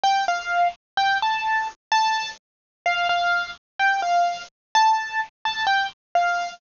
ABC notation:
X:1
M:2/4
L:1/8
Q:1/4=128
K:F
V:1 name="Acoustic Grand Piano"
g f2 z | g a2 z | a2 z2 | f f2 z |
g f2 z | a2 z a | g z f2 |]